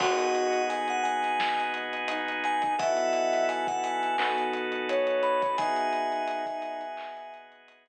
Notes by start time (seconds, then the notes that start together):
0.00 G#1 B3 D#4 F#4 G#4 D#5 F#5, kick, crash
0.19 closed hi-hat
0.35 closed hi-hat
0.53 closed hi-hat
0.69 G#5, closed hi-hat
0.88 F#5, closed hi-hat
1.03 G#5, closed hi-hat
1.23 snare, closed hi-hat
1.40 snare
1.60 closed hi-hat
1.74 closed hi-hat
1.93 closed hi-hat
2.08 D#4, closed hi-hat
2.28 closed hi-hat
2.44 G#5, snare, closed hi-hat
2.62 kick, closed hi-hat
2.78 B1 B3 E4 F#4 A4 D#5 E5 F#5, kick, closed hi-hat
2.97 closed hi-hat
3.13 closed hi-hat
3.33 snare, closed hi-hat
3.49 G#5, closed hi-hat
3.67 F#5, kick, closed hi-hat
3.84 G#5, closed hi-hat
4.03 closed hi-hat
4.18 B1 B3 D#4 F#4 A4, clap
4.38 closed hi-hat
4.53 closed hi-hat
4.72 closed hi-hat
4.89 C#5, closed hi-hat
5.07 closed hi-hat
5.23 B5, closed hi-hat
5.42 kick, closed hi-hat
5.57 G#1 B3 D#4 F#4 G#4 E5 G#5, kick, closed hi-hat
5.76 closed hi-hat
5.93 closed hi-hat
6.12 closed hi-hat
6.28 closed hi-hat
6.46 kick, closed hi-hat
6.62 closed hi-hat
6.81 closed hi-hat
6.97 clap
7.17 closed hi-hat
7.34 closed hi-hat
7.52 closed hi-hat
7.68 closed hi-hat
7.86 closed hi-hat